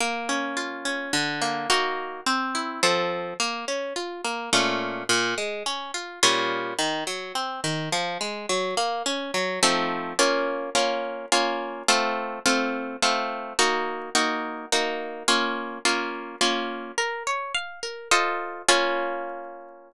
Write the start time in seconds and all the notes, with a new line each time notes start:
0.00 A#3
0.29 C#4
0.57 F4
0.85 C#4
1.13 D3
1.42 A#3
1.70 A#3 D#4 F#4
2.26 C4
2.55 E4
2.83 F3 C4 A4
3.40 A#3
3.68 C#4
3.96 F4
4.25 A#3
4.53 A#2 A3 C#4 F4
5.09 A#2
5.38 G#3
5.66 C#4
5.94 F4
6.23 A#2 G3 C#4 F4
6.79 D#3
7.07 F#3
7.35 C4
7.64 D#3
7.92 F3
8.21 G#3
8.49 F#3
8.77 A#3
9.06 C#4
9.34 F#3
9.63 F3 A3 C4 D#4
10.19 A#3 C#4 F4
10.75 A#3 C#4 F4
11.32 A#3 C#4 F4
11.88 A3 C4 F4
12.46 A3 C4 F4
13.02 A3 C4 F4
13.59 A#3 D#4 F#4
14.15 A#3 D#4 F#4
14.72 A#3 D#4 F#4
15.28 A#3 C#4 F4
15.85 A#3 C#4 F4
16.41 A#3 C#4 F4
16.98 A#4
17.27 C#5
17.54 F5
17.83 A#4
18.11 F4 A4 C5 D#5
18.69 A#3 C#4 F4